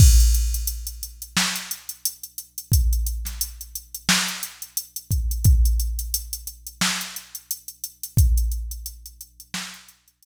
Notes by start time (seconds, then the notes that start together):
0.00 kick, crash
0.20 closed hi-hat
0.34 closed hi-hat
0.54 closed hi-hat
0.67 closed hi-hat
0.87 closed hi-hat
1.03 closed hi-hat
1.22 closed hi-hat
1.37 snare
1.56 closed hi-hat
1.71 closed hi-hat
1.89 closed hi-hat
2.05 closed hi-hat
2.23 closed hi-hat
2.38 closed hi-hat
2.58 closed hi-hat
2.72 kick, closed hi-hat
2.93 closed hi-hat
3.06 closed hi-hat
3.25 snare, closed hi-hat
3.41 closed hi-hat
3.61 closed hi-hat
3.75 closed hi-hat
3.94 closed hi-hat
4.09 snare
4.28 closed hi-hat
4.43 closed hi-hat
4.62 closed hi-hat
4.77 closed hi-hat
4.96 closed hi-hat
5.11 kick, closed hi-hat
5.31 closed hi-hat
5.44 kick, closed hi-hat
5.65 closed hi-hat
5.80 closed hi-hat
5.99 closed hi-hat
6.14 closed hi-hat
6.33 closed hi-hat
6.47 closed hi-hat
6.67 closed hi-hat
6.81 snare
7.01 closed hi-hat
7.16 closed hi-hat
7.35 closed hi-hat
7.51 closed hi-hat
7.68 closed hi-hat
7.84 closed hi-hat
8.03 closed hi-hat
8.17 kick, closed hi-hat
8.37 closed hi-hat
8.52 closed hi-hat
8.71 closed hi-hat
8.86 closed hi-hat
9.06 closed hi-hat
9.21 closed hi-hat
9.40 closed hi-hat
9.54 snare
9.74 closed hi-hat
9.88 closed hi-hat
10.08 closed hi-hat
10.23 closed hi-hat